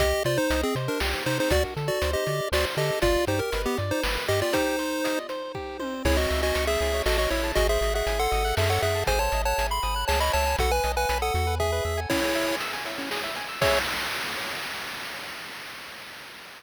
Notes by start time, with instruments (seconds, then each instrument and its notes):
0.00 synth bass 1 C2, lead 1 (square) G4 D#5, kick, closed hi-hat
0.24 synth bass 1 C3, lead 1 (square) F4 C5 D5, closed hi-hat
0.38 lead 1 (square) D#4 C5
0.50 synth bass 1 C2, lead 1 (square) D#5, closed hi-hat
0.63 lead 1 (square) C4 G#4
0.75 synth bass 1 C3, lead 1 (square) C5, closed hi-hat
0.88 lead 1 (square) D4 A#4
1.00 synth bass 1 C2, lead 1 (square) G4, snare
1.26 synth bass 1 C3, lead 1 (square) D#4 C5, open hi-hat
1.40 lead 1 (square) D#4 C5
1.50 synth bass 1 D2, lead 1 (square) F#4 D5, kick, closed hi-hat
1.77 synth bass 1 D3, lead 1 (square) A4, closed hi-hat
1.88 lead 1 (square) F#4 D5
2.02 synth bass 1 D2, lead 1 (square) C5, closed hi-hat
2.13 lead 1 (square) G4 D#5
2.27 synth bass 1 D3, lead 1 (square) D5, closed hi-hat
2.52 synth bass 1 D2, lead 1 (square) F#4 C5 D5, snare
2.77 synth bass 1 D3, lead 1 (square) G4 A4 D#5, closed hi-hat
3.02 synth bass 1 G1, lead 1 (square) F4 D5, kick, closed hi-hat
3.27 synth bass 1 G2, lead 1 (square) D#4 G4 C5, closed hi-hat
3.39 lead 1 (square) A#4
3.52 synth bass 1 G1, lead 1 (square) B4, closed hi-hat
3.66 lead 1 (square) B3 G4
3.78 synth bass 1 G2, lead 1 (square) D5, closed hi-hat
3.91 lead 1 (square) D#4 C5
4.03 synth bass 1 G1, lead 1 (square) B4, snare
4.28 synth bass 1 G2, lead 1 (square) G4 D#5, closed hi-hat
4.42 lead 1 (square) F4 D5
4.53 lead 1 (square) D#4 G4 C5, kick, closed hi-hat
4.79 lead 1 (square) C5, closed hi-hat
5.04 lead 1 (square) D#5, closed hi-hat
5.29 lead 1 (square) C5, closed hi-hat
5.55 lead 1 (square) G4, kick
5.80 lead 1 (square) C5, high tom
6.05 synth bass 1 C#2, lead 1 (square) E4 G#4 C#5, kick, crash
6.17 lead 1 (square) F#4 C#5 D#5
6.30 synth bass 1 C#2, lead 1 (square) E5, closed hi-hat
6.43 lead 1 (square) F#4 D#5 G#5
6.55 synth bass 1 C#2, lead 1 (square) C#6, closed hi-hat
6.67 lead 1 (square) G#4 E5 E6
6.81 synth bass 1 C#2, lead 1 (square) G#4, closed hi-hat
6.93 lead 1 (square) C#5
7.06 synth bass 1 A1, lead 1 (square) F#4 A4 D#5, snare
7.18 lead 1 (square) F#4 C#5 D#5
7.30 synth bass 1 A1, lead 1 (square) E4 C#5 E5, open hi-hat
7.44 lead 1 (square) A5
7.55 synth bass 1 G#1, lead 1 (square) F#4 G#4 D#5, kick, closed hi-hat
7.69 lead 1 (square) G#4 C5 E5
7.81 synth bass 1 G#1, lead 1 (square) D#5, closed hi-hat
7.94 lead 1 (square) G#4 E5 F#5
8.07 synth bass 1 G#1, lead 1 (square) G#5, closed hi-hat
8.19 lead 1 (square) A4 F#5 C6
8.32 synth bass 1 G#1, lead 1 (square) D#6, closed hi-hat
8.45 lead 1 (square) F#6
8.57 synth bass 1 F#2, lead 1 (square) G#4 A4 E5, snare
8.70 lead 1 (square) A4 C#5 F#5
8.82 synth bass 1 F#2, lead 1 (square) G#4 E5 F#5, closed hi-hat
8.95 lead 1 (square) A5
9.07 synth bass 1 G#1, lead 1 (square) G#4 C5 G#5, kick, closed hi-hat
9.19 lead 1 (square) C5 C#5 A5
9.32 synth bass 1 G#1, lead 1 (square) D#5, closed hi-hat
9.45 lead 1 (square) C#5 F#5 A5
9.58 synth bass 1 G#1, lead 1 (square) G#5, closed hi-hat
9.70 lead 1 (square) B5 C6
9.83 synth bass 1 G#1, lead 1 (square) D#6, closed hi-hat
9.96 lead 1 (square) F#6
10.08 synth bass 1 C#2, lead 1 (square) G#4 C#5 A5, snare
10.20 lead 1 (square) C#5 D#5 B5
10.33 synth bass 1 C#2, lead 1 (square) C#5 E5 A5, open hi-hat
10.46 lead 1 (square) G#5
10.59 synth bass 1 B1, lead 1 (square) F#4 A4 F#5, kick, closed hi-hat
10.71 lead 1 (square) B4 G#5
10.84 synth bass 1 B1, lead 1 (square) D#5, closed hi-hat
10.97 lead 1 (square) B4 F#5 G#5
11.09 synth bass 1 B1, lead 1 (square) B5, closed hi-hat
11.22 lead 1 (square) A4 F#5 D#6
11.34 synth bass 1 E2, lead 1 (square) F#4, closed hi-hat
11.47 lead 1 (square) B4
11.60 lead 1 (square) G#4 E5, kick
11.72 lead 1 (square) B4
11.85 synth bass 1 E2, lead 1 (square) E5
11.97 lead 1 (square) G#5
12.10 lead 1 (square) C#4 E4 C#5, kick, crash
12.23 lead 1 (square) G#4, closed hi-hat
12.35 lead 1 (square) E5, closed hi-hat
12.48 lead 1 (square) G#5, closed hi-hat
12.60 lead 1 (square) E6, closed hi-hat
12.73 lead 1 (square) G#5, closed hi-hat
12.86 lead 1 (square) E5, closed hi-hat
12.98 lead 1 (square) C#4, closed hi-hat
13.11 lead 1 (square) G#4, snare
13.23 lead 1 (square) E5, closed hi-hat
13.35 lead 1 (square) G#5, closed hi-hat
13.49 lead 1 (square) E6, closed hi-hat
13.61 lead 1 (square) G#4 C#5 E5, kick, crash